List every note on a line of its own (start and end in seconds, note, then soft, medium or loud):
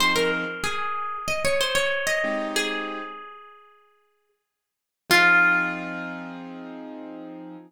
0.00 0.45 F3 medium
0.00 0.45 C4 medium
0.00 0.45 D#4 loud
0.00 0.45 G#4 medium
0.00 0.16 C5 medium
0.16 0.31 A#4 medium
0.64 1.18 G#4 medium
1.28 1.43 D#5 medium
1.45 1.60 C#5 medium
1.61 1.76 C5 medium
1.75 2.05 C#5 medium
2.07 2.47 D#5 medium
2.24 3.01 G#3 medium
2.24 3.01 C4 medium
2.24 3.01 D#4 loud
2.24 3.01 G4 medium
2.56 4.29 G#4 medium
5.10 7.56 F3 loud
5.10 7.56 C4 loud
5.10 7.56 D#4 loud
5.10 7.57 F4 loud
5.10 7.56 G#4 loud